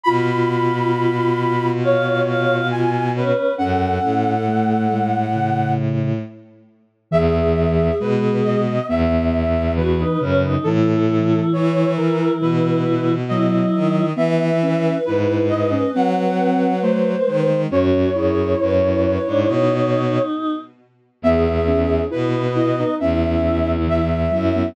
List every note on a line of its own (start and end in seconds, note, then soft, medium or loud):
0.03 3.32 B2 loud
0.03 2.90 F4 medium
0.03 1.66 F4 medium
0.03 1.70 B5 medium
1.83 2.56 C#5 medium
1.83 2.20 F5 medium
2.27 2.67 F5 medium
2.71 3.07 F4 medium
2.71 3.10 G#5 medium
3.16 3.53 C#4 medium
3.16 3.54 B4 medium
3.58 3.99 F#2 medium
3.58 4.35 C#4 medium
3.58 5.02 A4 medium
3.58 5.73 F#5 medium
4.03 6.19 A2 medium
4.48 4.87 A3 medium
4.91 5.30 G#3 medium
5.35 6.12 C#3 medium
7.11 7.91 E2 loud
7.11 7.88 E3 loud
7.11 8.60 G#4 medium
7.11 7.95 E5 medium
8.00 8.80 B2 loud
8.00 8.78 G#3 medium
8.00 8.37 B4 medium
8.44 8.86 D#5 medium
8.88 10.03 E2 loud
8.88 9.71 B3 medium
8.88 9.73 E5 medium
9.76 10.17 E3 medium
9.76 9.97 F#4 loud
9.76 10.53 B4 medium
9.98 10.19 D#4 medium
10.20 10.56 F#2 loud
10.20 10.58 C#3 medium
10.20 10.42 C#4 loud
10.43 10.64 D#4 medium
10.64 11.40 A2 loud
10.64 11.84 E3 loud
10.64 13.15 E4 loud
10.64 11.46 A4 medium
11.53 12.28 E3 loud
11.53 11.92 C#5 medium
11.96 12.40 E3 medium
11.96 12.37 A#4 medium
12.41 13.65 B2 medium
12.41 13.16 E3 loud
12.41 13.13 B4 medium
13.29 14.03 F#3 loud
13.29 14.05 E4 medium
13.29 14.11 D#5 medium
13.74 14.13 D#3 medium
14.15 14.93 E3 loud
14.15 14.52 B3 loud
14.15 17.50 B4 medium
14.15 14.96 E5 medium
14.62 14.98 C#4 loud
15.06 15.82 G#2 medium
15.06 15.46 E4 medium
15.06 15.43 B4 medium
15.49 15.71 E4 loud
15.49 15.90 D#5 medium
15.71 15.92 C#4 medium
15.94 17.15 F#3 medium
15.94 16.74 C4 loud
15.94 16.79 F#5 medium
16.82 17.23 A3 medium
16.82 17.60 C5 medium
17.27 17.67 D#3 medium
17.27 17.48 G#3 medium
17.49 17.70 G#3 medium
17.70 18.10 F#2 loud
17.70 18.09 C#4 loud
17.70 18.10 F#4 loud
17.70 20.22 C#5 medium
18.13 18.55 F#2 medium
18.13 19.73 E4 medium
18.13 18.53 G#4 medium
18.59 19.18 F#2 loud
18.59 18.80 B4 loud
18.81 19.02 B4 medium
19.03 19.24 B4 medium
19.26 19.48 G#2 loud
19.26 19.47 D4 medium
19.47 20.19 B2 loud
19.47 20.55 D#4 medium
21.22 22.02 E2 loud
21.22 21.65 B3 loud
21.22 22.04 G#4 medium
21.22 22.00 E5 medium
21.67 22.08 C#4 medium
22.10 22.83 B2 medium
22.10 22.95 B3 medium
22.10 22.47 E4 medium
22.10 22.53 B4 medium
22.55 22.76 E4 medium
22.55 22.94 D#5 medium
22.79 23.00 D#4 medium
23.00 24.30 E2 loud
23.00 23.77 C#4 medium
23.00 24.08 E4 medium
23.00 23.72 E5 medium
23.87 24.30 E3 medium
23.87 24.67 E5 medium
24.31 24.69 F#2 loud
24.31 24.52 F#3 medium
24.31 24.70 E4 medium
24.56 24.75 B3 medium